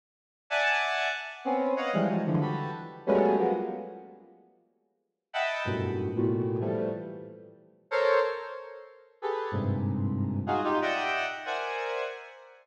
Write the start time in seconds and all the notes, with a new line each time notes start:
0.50 D5 E5 F#5 G#5 A5
1.45 B3 C4 C#4
1.76 C#5 D#5 F5 F#5
1.93 E3 F3 G3 G#3
2.08 E3 F3 F#3 G3 G#3
2.26 D3 E3 F3
2.41 F#4 G4 A4 B4
3.07 F#3 G3 G#3 A3 B3 C#4
3.38 F3 F#3 G#3 A#3 B3
5.33 D#5 E5 F#5 G5 A5 B5
5.65 F#2 G2 A2 A#2 B2
6.15 A2 A#2 B2
6.60 E3 F3 G3 A3
7.91 A4 A#4 C5 C#5
9.22 G4 G#4 A4 B4
9.51 G2 G#2 A#2 C3
10.47 D#4 F4 F#4 G#4
10.64 D#4 F4 G4
10.82 D5 D#5 E5 F#5 G5
11.45 A#4 C5 D5 E5 F#5 G#5